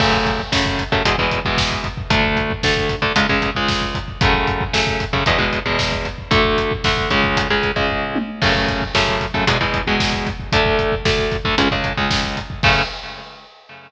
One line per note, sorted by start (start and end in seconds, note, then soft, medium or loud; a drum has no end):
0.00 0.41 F#2 medium
0.00 0.41 C#3 medium
0.00 0.41 A3 medium
0.00 kick medium
0.00 crash loud
0.13 kick medium
0.26 kick medium
0.26 closed hi-hat medium
0.39 kick medium
0.52 0.84 F#2 medium
0.52 0.84 C#3 medium
0.52 0.84 A3 medium
0.52 kick medium
0.52 snare loud
0.66 kick medium
0.79 kick medium
0.79 closed hi-hat medium
0.92 1.03 F#2 medium
0.92 1.03 C#3 medium
0.92 1.03 A3 medium
0.92 kick medium
1.05 1.16 E2 medium
1.05 1.16 B2 medium
1.05 1.16 G#3 medium
1.05 kick medium
1.05 closed hi-hat loud
1.18 1.40 E2 medium
1.18 1.40 B2 medium
1.18 1.40 G#3 medium
1.18 kick medium
1.31 kick medium
1.31 closed hi-hat medium
1.45 1.88 E2 medium
1.45 1.88 B2 medium
1.45 1.88 G#3 medium
1.45 kick medium
1.58 kick medium
1.58 snare loud
1.71 kick medium
1.84 kick medium
1.84 closed hi-hat medium
1.97 kick medium
2.10 2.52 D2 loud
2.10 2.52 D3 medium
2.10 2.52 A3 loud
2.10 kick loud
2.10 closed hi-hat loud
2.24 kick medium
2.37 kick medium
2.37 closed hi-hat medium
2.50 kick medium
2.63 2.96 D2 medium
2.63 2.96 D3 loud
2.63 2.96 A3 medium
2.63 kick medium
2.63 snare loud
2.77 kick medium
2.89 kick medium
2.89 closed hi-hat medium
3.02 3.13 D2 medium
3.02 3.13 D3 medium
3.02 3.13 A3 medium
3.02 kick medium
3.16 3.27 C#2 loud
3.16 3.27 C#3 medium
3.16 3.27 G#3 medium
3.16 kick medium
3.16 closed hi-hat loud
3.29 3.50 C#2 medium
3.29 3.50 C#3 medium
3.29 3.50 G#3 medium
3.29 kick medium
3.42 kick medium
3.42 closed hi-hat medium
3.55 3.98 C#2 medium
3.55 3.98 C#3 medium
3.55 3.98 G#3 medium
3.55 kick medium
3.68 kick medium
3.68 snare loud
3.82 kick medium
3.95 kick medium
3.95 closed hi-hat medium
4.08 kick medium
4.21 4.64 F#2 loud
4.21 4.64 C#3 medium
4.21 4.64 A3 loud
4.21 kick loud
4.21 closed hi-hat loud
4.34 kick medium
4.47 kick medium
4.47 closed hi-hat medium
4.61 kick medium
4.73 5.05 F#2 medium
4.73 5.05 C#3 medium
4.73 5.05 A3 medium
4.73 kick medium
4.73 snare loud
4.87 kick medium
5.00 kick medium
5.00 closed hi-hat medium
5.13 5.24 F#2 medium
5.13 5.24 C#3 medium
5.13 5.24 A3 medium
5.13 kick medium
5.26 5.38 E2 loud
5.26 5.38 B2 medium
5.26 5.38 G#3 medium
5.26 kick medium
5.26 closed hi-hat medium
5.38 5.59 E2 medium
5.38 5.59 B2 medium
5.38 5.59 G#3 medium
5.38 kick medium
5.53 kick medium
5.53 closed hi-hat medium
5.66 6.08 E2 medium
5.66 6.08 B2 medium
5.66 6.08 G#3 medium
5.66 kick medium
5.79 kick medium
5.79 snare loud
5.92 kick medium
6.05 kick medium
6.05 closed hi-hat medium
6.18 kick medium
6.31 6.73 D2 loud
6.31 6.73 D3 medium
6.31 6.73 A3 loud
6.31 kick loud
6.31 closed hi-hat medium
6.45 kick medium
6.58 kick medium
6.58 closed hi-hat medium
6.71 kick medium
6.84 7.10 D2 medium
6.84 7.10 D3 medium
6.84 7.10 A3 medium
6.84 kick medium
6.84 snare medium
6.97 kick medium
7.10 7.48 C#2 medium
7.10 7.48 C#3 loud
7.10 7.48 G#3 loud
7.10 kick medium
7.10 closed hi-hat medium
7.24 kick medium
7.37 kick medium
7.37 closed hi-hat loud
7.50 7.71 C#2 medium
7.50 7.71 C#3 medium
7.50 7.71 G#3 medium
7.50 kick medium
7.63 kick medium
7.63 closed hi-hat medium
7.76 8.18 C#2 medium
7.76 8.18 C#3 medium
7.76 8.18 G#3 medium
7.76 kick medium
7.89 kick medium
7.89 floor tom medium
8.15 high tom loud
8.42 8.84 F#2 loud
8.42 8.84 C#3 loud
8.42 8.84 A3 loud
8.42 kick loud
8.42 crash loud
8.55 kick medium
8.68 kick medium
8.68 closed hi-hat medium
8.82 kick medium
8.95 9.26 F#2 medium
8.95 9.26 C#3 medium
8.95 9.26 A3 medium
8.95 kick medium
8.95 snare loud
9.08 kick medium
9.21 kick medium
9.21 closed hi-hat medium
9.34 9.45 F#2 medium
9.34 9.45 C#3 medium
9.34 9.45 A3 medium
9.34 kick medium
9.47 9.58 E2 loud
9.47 9.58 B2 loud
9.47 9.58 G#3 loud
9.47 kick medium
9.47 closed hi-hat loud
9.61 9.82 E2 medium
9.61 9.82 B2 medium
9.61 9.82 G#3 medium
9.61 kick medium
9.74 kick medium
9.74 closed hi-hat medium
9.87 10.29 E2 medium
9.87 10.29 B2 medium
9.87 10.29 G#3 medium
9.87 kick medium
10.00 kick medium
10.00 snare loud
10.13 kick medium
10.27 kick medium
10.27 closed hi-hat medium
10.40 kick medium
10.52 10.95 D2 medium
10.52 10.95 D3 loud
10.52 10.95 A3 loud
10.52 kick loud
10.52 closed hi-hat loud
10.66 kick medium
10.79 kick medium
10.79 closed hi-hat medium
10.92 kick medium
11.05 11.37 D2 medium
11.05 11.37 D3 medium
11.05 11.37 A3 medium
11.05 kick loud
11.05 snare loud
11.19 kick medium
11.32 kick medium
11.32 closed hi-hat medium
11.45 11.55 D2 medium
11.45 11.55 D3 medium
11.45 11.55 A3 medium
11.45 kick medium
11.58 11.68 C#2 loud
11.58 11.68 C#3 loud
11.58 11.68 G#3 medium
11.58 kick medium
11.58 closed hi-hat loud
11.71 11.93 C#2 medium
11.71 11.93 C#3 medium
11.71 11.93 G#3 medium
11.71 kick medium
11.84 kick medium
11.84 closed hi-hat medium
11.97 12.39 C#2 medium
11.97 12.39 C#3 medium
11.97 12.39 G#3 medium
11.97 kick medium
12.11 kick medium
12.11 snare loud
12.24 kick medium
12.37 kick medium
12.37 closed hi-hat medium
12.50 kick medium
12.63 12.82 F#2 loud
12.63 12.82 C#3 loud
12.63 12.82 A3 medium
12.63 kick loud
12.63 crash loud